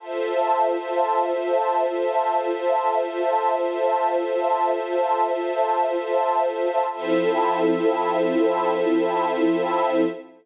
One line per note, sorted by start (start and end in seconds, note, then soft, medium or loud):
0.00 6.84 F4 medium
0.00 6.85 F4 medium
0.00 6.84 A4 medium
0.00 6.84 C5 medium
0.00 6.85 C5 medium
0.00 6.84 E5 medium
0.00 6.85 E5 medium
0.00 6.85 A5 medium
6.92 10.04 F3 medium
6.92 10.04 C4 medium
6.92 10.04 E4 loud
6.92 10.05 F4 loud
6.92 10.04 A4 loud
6.92 10.05 A4 loud
6.92 10.05 C5 medium
6.92 10.05 E5 loud